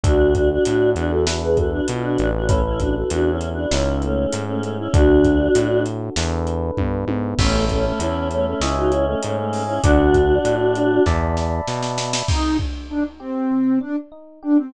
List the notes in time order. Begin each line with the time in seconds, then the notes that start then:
0.03 D2 D4 F#4 A4, kick, closed hi-hat
0.34 D4 F#4, kick, closed hi-hat
0.52 D4 F#4
0.64 A2 D4 F#4, closed hi-hat
0.96 E2 D4 F#4, closed hi-hat
1.10 F#4 A4
1.27 D4 E4 F#4 A4 B4, snare
1.42 G#4 B4
1.57 F#4 A4, kick, closed hi-hat
1.71 D4 F#4
1.88 B2 F4, closed hi-hat
2.03 D4 F#4
2.18 A1, closed hi-hat
2.35 D4 F#4
2.47 A3 C#4 E4 A4 B4, kick, closed hi-hat
2.65 C#4 E4
2.80 D4 F#4, kick, closed hi-hat
2.95 F#4 A4
3.10 E2 D4 F#4, closed hi-hat
3.30 C#4 E4
3.41 closed hi-hat
3.53 D4 F#4
3.71 C#2 C#4 D#4 E4 G#4, snare
4.02 A3 C#4, closed hi-hat
4.33 G#2, closed hi-hat
4.48 A3 C#4
4.62 A3 C#4, closed hi-hat
4.79 C#4 E4
4.93 D2 D4 F#4 A4, kick, closed hi-hat
5.24 kick, closed hi-hat
5.55 A2, closed hi-hat
5.86 closed hi-hat
6.16 E2 D4 E4 A4 B4, snare
6.47 closed hi-hat
6.77 G2, kick, high tom
7.07 G#2, high tom
7.38 A1 A3 C#4 C#5 E5 A5 B5, kick, crash
7.69 A3 C#4, kick, closed hi-hat
7.85 A3 C#4
7.99 E2 C#4 E4, closed hi-hat
8.31 A3 C#4, closed hi-hat
8.46 A3 C#4
8.60 C#2 C#4 E4 C#5 D#5 E5 G#5, snare
8.77 D#4 F#4
8.91 C#4 E4, closed hi-hat
9.06 A3 C#4
9.23 G#2 A3 C#4, closed hi-hat
9.38 A3 C#4
9.53 open hi-hat
9.67 C#4 E4
9.83 D2 D4 F#4 D5 F#5 A5, kick, closed hi-hat
10.14 kick, closed hi-hat
10.45 A2, closed hi-hat
10.75 closed hi-hat
11.06 E2 D5 E5 A5 B5, kick, snare
11.37 snare
11.67 B2, snare
11.83 snare
11.98 snare
12.13 snare
12.28 C3 D#4, kick, crash
12.59 D4, kick
12.89 D4 D#4
13.20 C4 G4
13.51 C3
13.81 D4
14.12 D#4
14.43 D4 G4
14.58 C4